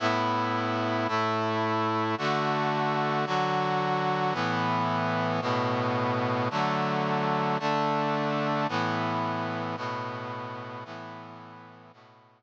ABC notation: X:1
M:3/4
L:1/8
Q:1/4=83
K:A
V:1 name="Brass Section"
[A,,B,E]3 [A,,A,E]3 | [D,A,F]3 [D,F,F]3 | [A,,E,B,]3 [A,,B,,B,]3 | [D,F,A,]3 [D,A,D]3 |
[A,,E,B,]3 [A,,B,,B,]3 | [A,,E,B,]3 [A,,B,,B,]3 |]